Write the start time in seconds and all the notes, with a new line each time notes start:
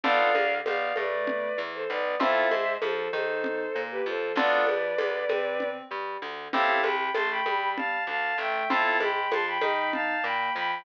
0.03 B1 B3 D4 F4 A4 D5 F5, low conga
0.35 D2 D3, high conga
0.66 B1 B3 D5 F5, tambourine, high conga
0.96 A2 A3 B4 D5, high conga
1.27 low conga
1.57 E2 E3
1.74 A4 C5
1.89 B1 B3 B4 D5
2.20 F2 C4 E4 F4 A4 C5 E5, low conga
2.51 G#2 G#3, high conga
2.82 F2 F3 A4 C5, tambourine, high conga
3.13 D#3 D#4 A4 C5, high conga
3.44 low conga
3.75 A#2 A#3
3.91 G4 B4
4.06 F2 F3 A4 C5
4.36 D2 B3 D4 F4 A4 B4 D5, low conga
4.67 F2 F3, high conga
4.98 D2 D3, tambourine, high conga
5.29 C3 C4, high conga
5.60 low conga
5.90 G2 G3
6.22 D2 D3
6.53 A1 C4 E4 G4 A4 F5 A5, low conga
6.83 C2 C3 G5 B5, high conga
7.14 A1 A3 A5 C6, tambourine, high conga
7.31 G5 B5
7.46 G2 G3, high conga
7.77 F5 A5, low conga
8.07 D2 D3 F5 A5
8.38 A1 A3 E5 G5
8.70 F2 C4 E4 F4 A4 F5 A5, low conga
9.00 G#2 G#3 G5 B5, high conga
9.31 F2 F3 A5 C6, tambourine, high conga
9.47 G5 B5
9.61 D#3 D#4, high conga
9.93 F5 A5, low conga
10.24 A#2 A#3 G5 B5
10.55 F2 F3 G5 B5